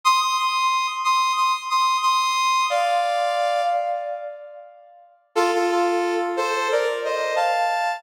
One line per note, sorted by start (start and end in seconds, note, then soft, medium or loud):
0.04 0.20 C6 medium
0.04 0.20 D#6 medium
0.20 0.36 C6 medium
0.20 0.36 D#6 medium
0.38 0.87 C6 medium
0.38 0.87 D#6 medium
1.04 1.32 C6 medium
1.04 1.32 D#6 medium
1.37 1.52 C6 medium
1.37 1.52 D#6 medium
1.70 1.97 C6 medium
1.70 1.97 D#6 medium
2.02 2.65 C6 medium
2.02 2.65 D#6 medium
2.70 3.61 D5 medium
2.70 3.61 F5 medium
5.35 5.51 F4 medium
5.35 5.51 A4 medium
5.55 5.70 F4 medium
5.55 5.70 A4 medium
5.71 6.14 F4 medium
5.71 6.14 A4 medium
6.37 6.68 A4 medium
6.37 6.68 C5 medium
6.72 6.88 A#4 medium
6.72 6.88 D5 medium
7.04 7.34 C5 medium
7.04 7.34 D#5 medium
7.36 7.97 F5 medium
7.36 7.97 A5 medium